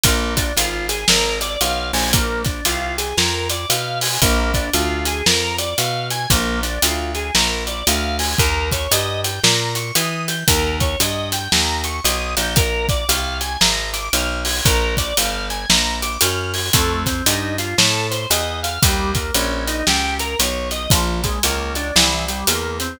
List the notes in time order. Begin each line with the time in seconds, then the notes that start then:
0.03 A#1 A#3, kick, closed hi-hat
0.37 D4, kick, closed hi-hat
0.57 G#1 F4, closed hi-hat
0.89 G#4, closed hi-hat
1.08 G#1 A#4, snare
1.41 D5, closed hi-hat
1.61 B1 F5, closed hi-hat
1.93 A#1 G#5, open hi-hat
2.13 A#3, kick, closed hi-hat
2.45 D4, kick, closed hi-hat
2.65 C2 F4, closed hi-hat
2.98 G#4, closed hi-hat
3.17 F2 A#4, snare
3.50 D5, closed hi-hat
3.70 B2 F5, closed hi-hat
4.01 G#5, open hi-hat
4.22 A#1 A#3, kick, closed hi-hat
4.54 D4, kick, closed hi-hat
4.73 D2 F4, closed hi-hat
5.05 G#4, closed hi-hat
5.26 F2 A#4, snare
5.58 D5, closed hi-hat
5.78 B2 F5, closed hi-hat
6.10 G#5, closed hi-hat
6.30 A#1 A#3, kick, closed hi-hat
6.63 D4, closed hi-hat
6.82 D2 F4, closed hi-hat
7.15 G#4, closed hi-hat
7.35 A#1 A#4, snare
7.67 D5, closed hi-hat
7.87 D2 F5, closed hi-hat
8.19 G#5, open hi-hat
8.38 D#2 A#4, kick, closed hi-hat
8.72 C#5, kick, closed hi-hat
8.91 G2 D#5, closed hi-hat
9.24 G5, closed hi-hat
9.43 A#2 A#5, snare
9.75 C#6, closed hi-hat
9.95 E3 D#6, closed hi-hat
10.28 G6, closed hi-hat
10.48 D#2 A#4, kick, closed hi-hat
10.80 C#5, kick, closed hi-hat
11.00 G2 D#5, closed hi-hat
11.32 G5, closed hi-hat
11.52 D#2 A#5, snare
11.84 C#6, closed hi-hat
12.04 B1 D#6, closed hi-hat
12.37 A#1 G6, closed hi-hat
12.56 A#4, kick, closed hi-hat
12.89 D5, kick, closed hi-hat
13.09 C2 F5, closed hi-hat
13.41 G#5, closed hi-hat
13.61 G#1 A#5, snare
13.93 D6, closed hi-hat
14.13 B1 F6, closed hi-hat
14.45 G#6, open hi-hat
14.65 A#1 A#4, kick, closed hi-hat
14.97 D5, kick, closed hi-hat
15.17 G1 F5, closed hi-hat
15.50 G#5, closed hi-hat
15.70 A#1 A#5, snare
16.02 D6, closed hi-hat
16.21 F#2 F6, closed hi-hat
16.54 G#6, open hi-hat
16.73 F2 A3, kick, closed hi-hat
17.06 C4, kick, closed hi-hat
17.26 G2 D#4, closed hi-hat
17.58 F4, closed hi-hat
17.78 A2 A4, snare
18.11 C5, closed hi-hat
18.30 E2 D#5, closed hi-hat
18.63 F5, closed hi-hat
18.82 D#2 G3, kick, closed hi-hat
19.15 A#3, kick, closed hi-hat
19.34 A#1 C#4, closed hi-hat
19.67 D#4, closed hi-hat
19.87 C#2 G4, snare
20.19 A#4, closed hi-hat
20.39 B1 C#5, closed hi-hat
20.71 D#5, closed hi-hat
20.90 A#1 F3, kick, closed hi-hat
21.24 G#3, kick, closed hi-hat
21.43 C#2 A#3, closed hi-hat
21.75 D4, closed hi-hat
21.96 C2 E3, snare
22.28 G3, closed hi-hat
22.47 E2 A#3, closed hi-hat
22.80 C4, closed hi-hat